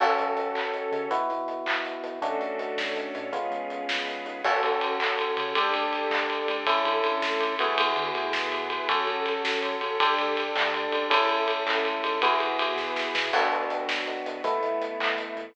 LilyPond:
<<
  \new Staff \with { instrumentName = "Electric Piano 1" } { \time 6/8 \key fis \minor \tempo 4. = 108 <cis' fis' a'>2. | <b e' fis'>2. | <a cis' d' fis'>2. | <gis b cis' eis'>2. |
<cis' fis' a'>2. | <d' g' a'>2. | <cis' e' a'>2~ <cis' e' a'>8 <b e' fis' gis'>8~ | <b e' fis' gis'>2. |
<cis' fis' a'>2. | <d' g' a'>2. | <cis' e' a'>2. | <b e' fis' gis'>2. |
\key a \major <b d' fis'>2. | <a b e'>2. | }
  \new Staff \with { instrumentName = "Synth Bass 1" } { \clef bass \time 6/8 \key fis \minor fis,8 fis,4 fis,4 cis8 | e,8 e,4 e,4 b,8 | d,8 d,4 d,4 a,8 | cis,8 cis,4 cis,4 gis,8 |
fis,8 fis,4 fis,4 cis8 | d,8 d,4 d,4 a,,8~ | a,,8 g,8 d,2 | e,8 d8 a,2 |
fis,8 fis,4 fis,4 cis8 | d,8 d,4 d,4 cis,8~ | cis,8 cis,4 cis,4 gis,8 | e,8 e,4 e,4 b,8 |
\key a \major a,,8 a,,4 a,,4 e,8 | a,,8 a,,4 a,,4 e,8 | }
  \new Staff \with { instrumentName = "String Ensemble 1" } { \time 6/8 \key fis \minor <cis' fis' a'>4. <cis' a' cis''>4. | r2. | <cis' d' fis' a'>4. <cis' d' a' cis''>4. | <b cis' eis' gis'>4. <b cis' gis' b'>4. |
<cis' fis' a'>4. <cis' a' cis''>4. | <d' g' a'>4. <d' a' d''>4. | <cis' e' a'>4. <a cis' a'>4. | <b e' fis' gis'>4. <b e' gis' b'>4. |
<cis' fis' a'>4. <cis' a' cis''>4. | <d' g' a'>4. <d' a' d''>4. | <cis' e' a'>4. <a cis' a'>4. | <b e' fis' gis'>4. <b e' gis' b'>4. |
\key a \major <b d' fis'>4. <fis b fis'>4. | <a b e'>4. <e a e'>4. | }
  \new DrumStaff \with { instrumentName = "Drums" } \drummode { \time 6/8 <cymc bd>8 hh8 hh8 <hc bd>8 hh8 hh8 | <hh bd>8 hh8 hh8 <hc bd>8 hh8 hh8 | <hh bd>8 hh8 hh8 <bd sn>8 hh8 hh8 | <hh bd>8 hh8 hh8 <bd sn>8 hh8 hh8 |
<cymc bd>8 cymr8 cymr8 <hc bd>8 cymr8 cymr8 | <bd cymr>8 cymr8 cymr8 <hc bd>8 cymr8 cymr8 | <bd cymr>8 cymr8 cymr8 <bd sn>8 cymr8 cymr8 | <bd cymr>8 cymr8 cymr8 <bd sn>8 cymr8 cymr8 |
<bd cymr>8 cymr8 cymr8 <bd sn>8 cymr8 cymr8 | <bd cymr>8 cymr8 cymr8 <hc bd>8 cymr8 cymr8 | <bd cymr>8 cymr8 cymr8 <hc bd>8 cymr8 cymr8 | <bd cymr>8 cymr8 cymr8 <bd sn>8 sn8 sn8 |
<cymc bd>8 hh8 hh8 <bd sn>8 hh8 hh8 | <hh bd>8 hh8 hh8 <hc bd>8 hh8 hh8 | }
>>